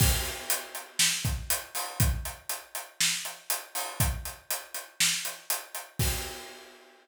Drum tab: CC |x-------|--------|--------|x-------|
HH |-xxx-xxo|xxxx-xxo|xxxx-xxx|--------|
SD |----o---|----o---|----o---|--------|
BD |o----o--|o-------|o-------|o-------|